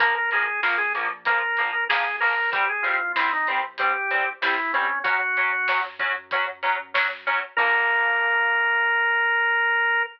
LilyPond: <<
  \new Staff \with { instrumentName = "Drawbar Organ" } { \time 4/4 \key bes \major \tempo 4 = 95 bes'16 bes'16 aes'8 f'16 aes'16 r8 bes'4 aes'8 bes'8 | g'16 aes'16 f'8 fes'16 ees'16 r8 g'4 e'8 des'8 | ges'4. r2 r8 | bes'1 | }
  \new Staff \with { instrumentName = "Acoustic Guitar (steel)" } { \time 4/4 \key bes \major <f bes>8 <f bes>8 <f bes>8 <f bes>8 <f bes>8 <f bes>8 <f bes>8 <f bes>8 | <g c'>8 <g c'>8 <g c'>8 <g c'>8 <g c'>8 <g c'>8 <g c'>8 <g c'>8 | <ges des'>8 <ges des'>8 <ges des'>8 <ges des'>8 <ges des'>8 <ges des'>8 <ges des'>8 <ges des'>8 | <f bes>1 | }
  \new Staff \with { instrumentName = "Synth Bass 1" } { \clef bass \time 4/4 \key bes \major bes,,1 | c,2. e,8 f,8 | ges,1 | bes,,1 | }
  \new DrumStaff \with { instrumentName = "Drums" } \drummode { \time 4/4 <hh bd>8 hh8 sn8 hh8 <hh bd>8 hh8 sn8 hho8 | <hh bd>8 hh8 sn8 hh8 <hh bd>8 hh8 sn8 hh8 | <hh bd>8 hh8 sn8 <hh bd>8 <hh bd>8 hh8 sn8 hh8 | <cymc bd>4 r4 r4 r4 | }
>>